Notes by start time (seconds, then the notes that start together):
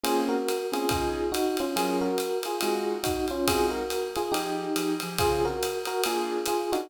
0.03 A#3 C4 C#4 F4 G#4, ride
0.29 F#4 A#4
0.48 hi-hat pedal, ride
0.72 A#3 C4 C#4 F4 G#4, ride
0.89 C#3 D#4 F4 G#4, kick, ride
1.32 D#4 F#4, hi-hat pedal, ride
1.57 C#4 F4, ride
1.76 F#3 C#4 F4 G#4 A#4, ride
2.01 F#4 A#4
2.18 hi-hat pedal, ride
2.43 F4 G#4, ride
2.61 G#3 C4 D#4 F4 F#4 G#4, ride
3.03 D#4 F#4, kick, hi-hat pedal, ride
3.28 C#4 F4, ride
3.47 G#3 C4 D#4 F4 F#4 G#4, kick, ride
3.70 F#4 A#4
3.90 hi-hat pedal, ride
4.16 F4 G#4, ride
4.32 F3 D#4 G4 G#4, ride
4.76 F3 D#4 G4 G#4, hi-hat pedal, ride
5.00 F3 D#4 G4 G#4, ride
5.18 C#3 C4 F4 G#4, kick, ride
5.45 F#4 A#4
5.62 hi-hat pedal, ride
5.85 F#4 A#4, ride
6.03 A#3 D4 F4 G#4, ride
6.45 F4 G#4, hi-hat pedal, ride
6.72 A#3 D4 D#4 F4 F#4 G#4, ride